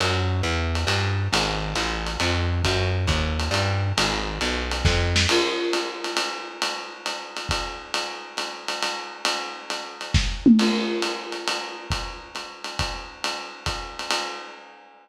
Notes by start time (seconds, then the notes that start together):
0.00 F#2, ride
0.43 E2, hi-hat pedal
0.75 ride
0.87 G2, ride
1.33 G#1, ride
1.75 A1, hi-hat pedal, ride
2.07 ride
2.20 F2, ride
2.64 F#2, kick, ride
3.07 D#2, kick, hi-hat pedal, ride
3.40 ride
3.51 G2, ride
3.98 G#1, ride
4.41 B1, hi-hat pedal, ride
4.72 ride
4.85 F2, kick, snare
5.16 snare
5.29 crash, ride
5.73 hi-hat pedal, ride
6.04 ride
6.17 ride
6.62 ride
7.06 hi-hat pedal, ride
7.37 ride
7.49 kick, ride
7.94 ride
8.37 hi-hat pedal, ride
8.68 ride
8.83 ride
9.25 ride
9.70 hi-hat pedal, ride
10.01 ride
10.14 kick, snare
10.46 mid tom
10.59 crash, ride
11.02 hi-hat pedal, ride
11.32 ride
11.48 ride
11.90 kick, ride
12.35 hi-hat pedal, ride
12.64 ride
12.79 kick, ride
13.24 ride
13.66 kick, hi-hat pedal, ride
13.99 ride
14.11 ride